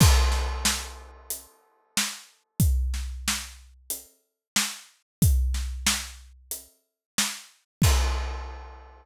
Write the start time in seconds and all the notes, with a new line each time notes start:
0.00 kick, crash
0.32 snare
0.65 snare
1.30 closed hi-hat
1.97 snare
2.60 kick, closed hi-hat
2.94 snare
3.28 snare
3.90 closed hi-hat
4.56 snare
5.22 kick, closed hi-hat
5.54 snare
5.87 snare
6.51 closed hi-hat
7.18 snare
7.82 kick, crash